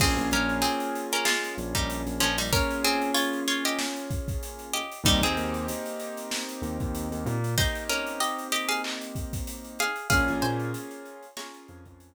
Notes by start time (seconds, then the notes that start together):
0.00 A#1 A#3 C4 C#4 F4 G#4, kick, crash
0.17 A#1, closed hi-hat
0.31 A#1 C#4 A#4, closed hi-hat
0.49 closed hi-hat
0.62 C4 G#4, closed hi-hat
0.80 closed hi-hat
0.95 closed hi-hat
1.12 C#4 A#4, closed hi-hat
1.25 G#3 F4, snare
1.44 snare, closed hi-hat
1.58 A#1, closed hi-hat
1.75 A#1 G3 D#4, kick, closed hi-hat
1.90 closed hi-hat
2.06 A#1, snare, closed hi-hat
2.20 A#1 F3 C#4, closed hi-hat
2.38 G3 D#4, open hi-hat
2.53 A#3 C#4 F4 G#4 A#4, kick, closed hi-hat
2.70 closed hi-hat
2.84 C4 G#4, closed hi-hat
3.01 closed hi-hat
3.14 F4 C#5, closed hi-hat
3.33 closed hi-hat
3.48 F4 C#5, closed hi-hat
3.65 G4 D#5, closed hi-hat
3.79 snare
3.96 closed hi-hat
4.11 kick, closed hi-hat
4.28 kick, closed hi-hat
4.43 closed hi-hat
4.59 closed hi-hat
4.73 G4 D#5, closed hi-hat
4.92 closed hi-hat
5.04 D#2 G3 A#3 C4 D#4 G4, kick, closed hi-hat
5.21 D#2 C4 G#4, closed hi-hat
5.37 D#2, closed hi-hat
5.54 closed hi-hat
5.68 closed hi-hat
5.86 closed hi-hat
5.99 closed hi-hat
6.17 closed hi-hat
6.31 snare
6.49 closed hi-hat
6.62 D#2, closed hi-hat
6.80 D#2, kick, closed hi-hat
6.95 closed hi-hat
7.12 D#2, closed hi-hat
7.26 A#2, closed hi-hat
7.44 closed hi-hat
7.58 A#3 C4 D#4 G4 C5, kick, closed hi-hat
7.75 closed hi-hat
7.89 C#4 A#4, closed hi-hat
8.07 closed hi-hat
8.20 G4 D#5, closed hi-hat
8.38 closed hi-hat
8.52 G4 D#5, closed hi-hat
8.69 G#4 F5, closed hi-hat
8.84 clap
9.01 closed hi-hat
9.15 kick, closed hi-hat
9.33 kick, closed hi-hat
9.47 closed hi-hat
9.64 closed hi-hat
9.79 G#4 F5, snare, closed hi-hat
9.96 closed hi-hat
10.10 A#1 A#3 C#4 F4 G#4 F5, kick, closed hi-hat
10.28 A#1, closed hi-hat
10.42 A#2 C5 G#5, closed hi-hat
10.59 closed hi-hat
10.74 closed hi-hat
10.91 closed hi-hat
11.05 closed hi-hat
11.23 closed hi-hat
11.37 A#3 C#4 F4 G#4 C#5 A#5, snare
11.54 snare, closed hi-hat
11.68 F2, closed hi-hat
11.85 F2, kick, closed hi-hat
12.00 closed hi-hat